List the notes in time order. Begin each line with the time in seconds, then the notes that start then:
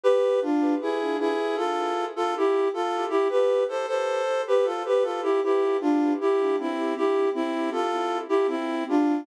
0.04 G4 B4
0.41 D4 F4
0.81 E4 G#4
1.20 E4 G#4
1.56 F4 A4
2.16 F4 A4
2.37 E4 G4
2.74 F4 A4
3.10 E4 G4
3.29 G4 B4
3.69 A4 C5
3.87 A4 C5
4.47 G4 B4
4.64 F4 A4
4.85 G4 B4
5.02 F4 A4
5.22 E4 G4
5.43 E4 G4
5.81 D4 F4
6.21 E4 G4
6.59 C4 E4
6.96 E4 G4
7.35 C4 E4
7.71 F4 A4
8.29 E4 G4
8.47 C4 E4
8.89 D4 F4